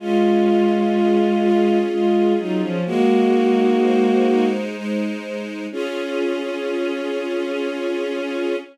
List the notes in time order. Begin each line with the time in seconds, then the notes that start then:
0.00 G#3 C#4 F4
0.47 F4
0.96 G#4
1.42 F4
1.91 G#3 C#4 F4
2.39 F#3 D#4 F4
2.61 F3 C#4
2.85 G#3 A#3 F#4
3.33 D#4
3.82 C5
4.29 D#4
4.76 G#3
5.24 D#4
5.72 C#4 F4 G#4